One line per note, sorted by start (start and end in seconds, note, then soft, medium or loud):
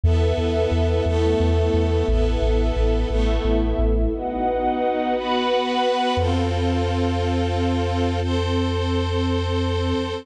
0.04 0.33 E2 loud
0.04 1.05 B3 loud
0.04 1.05 E4 medium
0.04 1.05 A4 medium
0.04 1.05 B4 medium
0.04 1.05 E5 medium
0.37 0.66 E2 loud
0.72 1.01 E2 loud
1.05 1.35 E2 loud
1.05 2.07 A3 medium
1.05 2.07 B3 loud
1.05 2.07 E4 medium
1.05 2.07 A4 medium
1.05 2.07 E5 medium
1.40 1.69 E2 loud
1.74 2.03 E2 loud
2.08 2.37 A1 loud
2.08 3.09 B3 loud
2.08 3.09 E4 medium
2.08 3.09 A4 loud
2.08 3.09 A4 medium
2.08 3.09 B4 medium
2.08 3.09 E5 medium
2.42 2.71 A1 loud
2.76 3.05 A1 loud
3.10 3.39 A1 loud
3.10 4.11 A3 loud
3.10 4.11 B3 loud
3.10 4.12 E4 loud
3.10 4.11 A4 medium
3.10 4.12 A4 medium
3.10 4.12 E5 medium
3.45 3.74 A1 loud
3.79 4.08 A1 loud
4.13 5.14 B3 medium
4.13 5.14 D#4 loud
4.13 5.14 F#4 medium
4.13 5.14 B4 loud
4.13 5.14 D#5 medium
4.13 5.14 F#5 medium
5.14 6.16 B3 loud
5.14 6.16 F#4 loud
5.14 6.16 B4 loud
5.14 6.17 B4 loud
5.14 6.17 F#5 medium
5.14 6.17 B5 loud
6.17 9.93 F2 medium
6.17 8.20 C4 loud
6.17 8.20 F4 loud
6.17 8.20 A4 medium
8.22 10.24 C4 medium
8.22 10.24 A4 medium
8.22 10.24 C5 medium